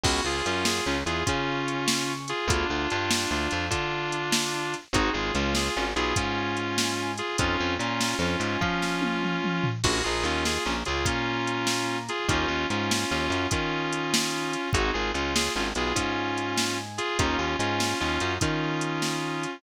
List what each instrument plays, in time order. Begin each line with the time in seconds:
0.04 electric bass (finger) C#2, drawbar organ B3 C#4 F4 G#4, distortion guitar F#4, kick, crash
0.24 electric bass (finger) C#2, drawbar organ C#3, distortion guitar F4 G#4
0.46 electric bass (finger) F#2, drawbar organ F#3, distortion guitar C#4 F4, closed hi-hat
0.65 distortion guitar F4 G#4, snare
0.86 electric bass (finger) C#2, drawbar organ C#3, distortion guitar C#4 F4
1.06 electric bass (finger) E2, drawbar organ E3, distortion guitar F4 G#4, closed hi-hat
1.26 electric bass (finger) C#3, distortion guitar C#4 F4, drawbar organ C#4, kick, closed hi-hat
1.68 closed hi-hat
1.88 snare
2.28 distortion guitar F4 G#4, closed hi-hat
2.48 electric bass (finger) D2, drawbar organ B3 D4 F4 G#4, distortion guitar D4 F4, kick, closed hi-hat
2.70 electric bass (finger) D2, drawbar organ D3
2.90 electric bass (finger) G2, drawbar organ G3, distortion guitar D4 F4, closed hi-hat
3.11 snare
3.31 electric bass (finger) D2, drawbar organ D3, distortion guitar D4 F4
3.51 electric bass (finger) F2, drawbar organ F3, closed hi-hat
3.70 electric bass (finger) D3, distortion guitar D4 F4, drawbar organ D4, kick, closed hi-hat
4.12 closed hi-hat
4.32 snare
4.74 closed hi-hat
4.93 electric bass (finger) G#1, drawbar organ C4 D#4 F#4 G#4, distortion guitar D#4 F#4, kick, closed hi-hat
5.13 electric bass (finger) G#1, drawbar organ G#3, distortion guitar F4 G#4
5.34 electric bass (finger) C#2, drawbar organ C#3, distortion guitar C#4 F4, closed hi-hat
5.55 distortion guitar F4 G#4, snare
5.76 electric bass (finger) G#1, drawbar organ G#3, distortion guitar C#4 F4
5.96 electric bass (finger) B1, drawbar organ B3, distortion guitar F4 G#4, closed hi-hat
6.16 electric bass (finger) G#2, drawbar organ G#3, distortion guitar C#4 F4, kick, closed hi-hat
6.57 closed hi-hat
6.78 snare
7.18 distortion guitar F4 G#4, closed hi-hat
7.38 electric bass (finger) F2, drawbar organ C4 D#4 F4 A4, distortion guitar C#4 F4, kick, closed hi-hat
7.59 electric bass (finger) F2, drawbar organ F3
7.79 electric bass (finger) A#2, drawbar organ A#3, distortion guitar C#4 F4, closed hi-hat
8.01 snare
8.19 electric bass (finger) F2, drawbar organ F3, distortion guitar C#4 F4
8.40 electric bass (finger) G#2, drawbar organ G#3, closed hi-hat
8.61 electric bass (finger) F3, distortion guitar C#4 F4, drawbar organ F4, kick
8.82 snare
9.02 high tom
9.23 mid tom
9.44 mid tom
9.64 floor tom
9.83 electric bass (finger) A#1, drawbar organ C#4 F4 G#4 A#4, distortion guitar F#4, kick, crash
10.04 electric bass (finger) A#1, drawbar organ A#3, distortion guitar F4 G#4
10.23 electric bass (finger) D#2, drawbar organ D#3, distortion guitar C#4 F4, closed hi-hat
10.45 distortion guitar F4 G#4, snare
10.65 electric bass (finger) A#1, drawbar organ A#3, distortion guitar C#4 F4
10.85 electric bass (finger) C#2, drawbar organ C#3, distortion guitar F4 G#4, closed hi-hat
11.05 electric bass (finger) A#2, drawbar organ A#3, distortion guitar C#4 F4, kick, closed hi-hat
11.47 closed hi-hat
11.67 snare
12.09 distortion guitar F4 G#4, closed hi-hat
12.28 electric bass (finger) D#2, drawbar organ C#4 D#4 G4 A#4, distortion guitar C#4 F4, kick, closed hi-hat
12.48 electric bass (finger) D#2, drawbar organ D#3
12.70 electric bass (finger) G#2, drawbar organ G#3, distortion guitar C#4 F4, closed hi-hat
12.91 snare
13.11 electric bass (finger) D#2, drawbar organ D#3, distortion guitar C#4 F4
13.30 electric bass (finger) F#2, drawbar organ F#3, closed hi-hat
13.50 electric bass (finger) D#3, distortion guitar C#4 F4, drawbar organ D#4, kick, closed hi-hat
13.93 closed hi-hat
14.14 snare
14.53 closed hi-hat
14.73 electric bass (finger) G#1, drawbar organ C4 D#4 F#4 G#4, distortion guitar D#4 F#4, kick, closed hi-hat
14.93 electric bass (finger) G#1, drawbar organ G#3, distortion guitar F4 G#4
15.14 electric bass (finger) C#2, drawbar organ C#3, distortion guitar C#4 F4, closed hi-hat
15.36 distortion guitar F4 G#4, snare
15.55 electric bass (finger) G#1, drawbar organ G#3, distortion guitar C#4 F4
15.75 electric bass (finger) B1, drawbar organ B3, distortion guitar F4 G#4, closed hi-hat
15.95 electric bass (finger) G#2, drawbar organ G#3, distortion guitar C#4 F4, kick, closed hi-hat
16.38 closed hi-hat
16.58 snare
16.98 distortion guitar F4 G#4, closed hi-hat
17.19 electric bass (finger) D#2, drawbar organ A#3 C#4 D#4 G4, distortion guitar C#4 F4, kick, closed hi-hat
17.38 electric bass (finger) D#2, drawbar organ D#3
17.59 electric bass (finger) G#2, drawbar organ G#3, distortion guitar C#4 F4, closed hi-hat
17.80 snare
18.00 electric bass (finger) D#2, drawbar organ D#3, distortion guitar C#4 F4
18.20 electric bass (finger) F#2, drawbar organ F#3, closed hi-hat
18.40 electric bass (finger) D#3, distortion guitar C#4 F4, drawbar organ D#4, kick, closed hi-hat
18.81 closed hi-hat
19.02 snare
19.43 closed hi-hat